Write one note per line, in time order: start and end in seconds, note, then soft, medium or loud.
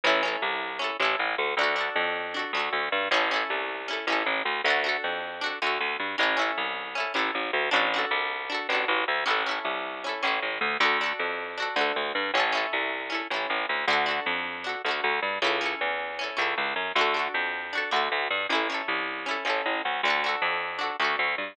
0.04 0.37 A1 loud
0.04 0.22 C#4 medium
0.04 0.22 E4 loud
0.09 0.22 A4 medium
0.23 0.76 C#4 medium
0.23 0.76 E4 medium
0.28 0.76 A4 medium
0.42 0.91 C2 medium
0.79 0.97 C#4 medium
0.79 0.97 E4 medium
0.84 0.97 A4 medium
1.00 1.16 A1 loud
1.00 1.53 C#4 medium
1.00 1.53 E4 medium
1.05 1.53 A4 medium
1.19 1.36 A1 medium
1.38 1.55 D2 loud
1.57 1.90 D2 loud
1.57 1.75 D4 medium
1.61 1.76 F#4 medium
1.61 1.76 A4 medium
1.76 2.29 D4 medium
1.76 2.29 F#4 medium
1.81 2.29 A4 medium
1.96 2.45 F2 loud
2.34 2.52 D4 medium
2.34 2.52 F#4 medium
2.39 2.52 A4 medium
2.53 2.69 D2 medium
2.53 3.08 D4 medium
2.57 3.08 F#4 medium
2.57 3.08 A4 medium
2.73 2.89 D2 medium
2.92 3.09 G2 loud
3.11 3.44 A1 loud
3.11 3.29 C#4 loud
3.11 3.29 E4 medium
3.16 3.29 A4 medium
3.31 3.84 C#4 medium
3.31 3.84 E4 medium
3.36 3.84 A4 medium
3.50 3.99 C2 medium
3.88 4.06 C#4 medium
3.88 4.06 E4 medium
3.93 4.06 A4 medium
4.07 4.23 A1 medium
4.07 4.61 C#4 medium
4.07 4.61 E4 medium
4.12 4.61 A4 medium
4.26 4.43 A1 medium
4.45 4.62 D2 medium
4.64 4.97 D2 loud
4.64 4.83 D4 loud
4.64 4.83 F#4 medium
4.70 4.83 A4 medium
4.84 5.37 D4 medium
4.84 5.37 F#4 medium
4.89 5.37 A4 medium
5.04 5.53 F2 medium
5.41 5.59 D4 medium
5.41 5.59 F#4 medium
5.46 5.59 A4 medium
5.62 5.78 D2 loud
5.62 6.15 D4 medium
5.62 6.15 F#4 medium
5.67 6.15 A4 medium
5.80 5.97 D2 medium
6.00 6.16 G2 medium
6.18 6.52 A1 loud
6.18 6.36 C#4 medium
6.18 6.36 E4 medium
6.23 6.36 A4 medium
6.37 6.90 C#4 medium
6.37 6.90 E4 medium
6.42 6.90 A4 medium
6.58 7.07 C2 medium
6.95 7.13 C#4 medium
6.95 7.13 E4 medium
7.00 7.13 A4 medium
7.14 7.31 A1 medium
7.14 7.67 C#4 medium
7.14 7.67 E4 medium
7.19 7.67 A4 medium
7.35 7.51 A1 medium
7.53 7.70 D2 medium
7.71 8.05 A1 loud
7.71 7.89 D4 medium
7.71 7.89 F#4 medium
7.76 7.89 A4 medium
7.94 8.47 D4 medium
7.94 8.47 F#4 medium
7.99 8.47 A4 medium
8.11 8.60 C2 medium
8.50 8.67 D4 medium
8.50 8.67 F#4 medium
8.54 8.67 A4 medium
8.69 8.85 A1 medium
8.69 9.23 D4 medium
8.69 9.23 F#4 medium
8.75 9.23 A4 medium
8.88 9.05 A1 loud
9.08 9.24 D2 medium
9.26 9.59 A1 medium
9.26 9.43 C#4 medium
9.26 9.43 E4 medium
9.30 9.43 A4 medium
9.46 9.99 C#4 medium
9.46 9.99 E4 medium
9.51 9.99 A4 medium
9.65 10.14 C2 medium
10.04 10.22 C#4 medium
10.04 10.22 E4 medium
10.09 10.22 A4 medium
10.23 10.40 A1 medium
10.23 10.76 C#4 medium
10.23 10.76 E4 medium
10.27 10.76 A4 medium
10.42 10.59 A1 medium
10.61 10.77 D2 loud
10.80 11.13 D2 loud
10.80 10.98 D4 loud
10.80 10.98 F#4 medium
10.85 10.98 A4 medium
11.01 11.54 D4 medium
11.01 11.54 F#4 medium
11.06 11.54 A4 medium
11.19 11.68 F2 medium
11.58 11.75 D4 medium
11.58 11.75 F#4 medium
11.62 11.75 A4 medium
11.76 11.92 D2 loud
11.76 12.29 D4 medium
11.76 12.29 F#4 medium
11.81 12.29 A4 medium
11.96 12.12 D2 medium
12.15 12.31 G2 loud
12.34 12.66 A1 loud
12.34 12.52 C#4 medium
12.34 12.53 E4 medium
12.40 12.53 A4 medium
12.52 13.06 C#4 medium
12.52 13.06 E4 medium
12.57 13.06 A4 medium
12.73 13.22 C2 medium
13.10 13.27 C#4 medium
13.10 13.27 E4 medium
13.15 13.27 A4 medium
13.30 13.47 A1 medium
13.30 13.84 C#4 medium
13.30 13.84 E4 medium
13.36 13.84 A4 medium
13.50 13.66 A1 medium
13.69 13.86 D2 medium
13.87 14.20 D2 loud
13.87 14.06 D4 medium
13.87 14.06 F#4 loud
13.93 14.06 A4 medium
14.06 14.59 D4 medium
14.06 14.59 F#4 medium
14.11 14.59 A4 medium
14.26 14.75 F2 medium
14.64 14.82 D4 medium
14.64 14.82 F#4 medium
14.69 14.82 A4 medium
14.85 15.01 D2 medium
14.85 15.39 D4 medium
14.85 15.39 F#4 medium
14.91 15.39 A4 medium
15.04 15.20 D2 loud
15.22 15.39 G2 medium
15.42 15.75 C#2 loud
15.42 15.60 C#4 medium
15.42 15.60 E4 medium
15.47 15.60 A4 loud
15.61 16.14 C#4 medium
15.61 16.14 E4 medium
15.66 16.14 A4 medium
15.81 16.30 E2 medium
16.19 16.36 C#4 medium
16.19 16.37 E4 medium
16.24 16.37 A4 medium
16.37 16.54 C#2 loud
16.37 16.90 C#4 medium
16.37 16.90 E4 medium
16.42 16.90 A4 medium
16.58 16.74 C#2 medium
16.76 16.92 F#2 medium
16.95 17.28 D2 loud
16.95 17.14 D4 medium
16.95 17.14 F#4 medium
17.01 17.14 A4 medium
17.14 17.67 D4 medium
17.14 17.67 F#4 medium
17.19 17.67 A4 medium
17.34 17.83 F2 medium
17.73 17.91 D4 medium
17.73 17.91 F#4 medium
17.78 17.91 A4 medium
17.91 18.09 D2 loud
17.91 18.44 D4 medium
17.91 18.44 F#4 medium
17.96 18.44 A4 medium
18.12 18.28 D2 loud
18.30 18.47 G2 medium
18.49 18.82 A1 medium
18.49 18.68 C#4 medium
18.49 18.68 E4 medium
18.55 18.68 A4 medium
18.70 19.23 C#4 medium
18.70 19.23 E4 medium
18.74 19.23 A4 medium
18.88 19.37 C2 medium
19.26 19.44 C#4 medium
19.26 19.44 E4 medium
19.31 19.44 A4 medium
19.45 19.62 A1 medium
19.45 19.98 C#4 medium
19.45 19.98 E4 medium
19.50 19.98 A4 medium
19.66 19.82 A1 medium
19.85 20.01 D2 medium
20.03 20.36 D2 loud
20.03 20.23 D4 medium
20.08 20.23 F#4 medium
20.08 20.23 A4 medium
20.24 20.77 D4 medium
20.24 20.77 F#4 medium
20.29 20.77 A4 medium
20.42 20.91 F2 loud
20.79 20.96 D4 medium
20.79 20.96 F#4 medium
20.83 20.96 A4 medium
21.00 21.16 D2 loud
21.00 21.53 D4 medium
21.00 21.53 F#4 medium
21.04 21.53 A4 medium
21.19 21.35 D2 medium
21.38 21.54 G2 medium